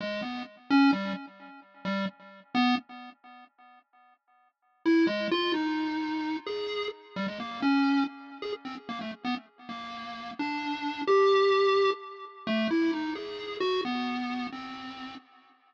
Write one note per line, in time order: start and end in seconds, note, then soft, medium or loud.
0.00 0.21 G#3 medium
0.22 0.43 B3 soft
0.70 0.91 C#4 loud
0.92 1.13 G3 medium
1.85 2.06 G3 medium
2.55 2.75 B3 loud
4.85 5.06 E4 loud
5.07 5.28 G#3 medium
5.31 5.52 F4 loud
5.54 6.37 D#4 medium
6.46 6.88 G#4 medium
7.16 7.27 G3 medium
7.28 7.38 G#3 soft
7.40 7.60 A#3 medium
7.62 8.04 C#4 medium
8.42 8.52 G#4 medium
8.65 8.75 C4 medium
8.89 8.99 A#3 medium
9.01 9.11 A3 medium
9.25 9.35 B3 medium
9.69 10.31 A#3 medium
10.39 11.02 D4 medium
11.07 11.90 G4 loud
12.47 12.68 A3 loud
12.71 12.91 E4 medium
12.93 13.14 D#4 medium
13.15 13.57 G#4 medium
13.60 13.81 F#4 loud
13.85 14.47 B3 medium
14.52 15.15 C4 soft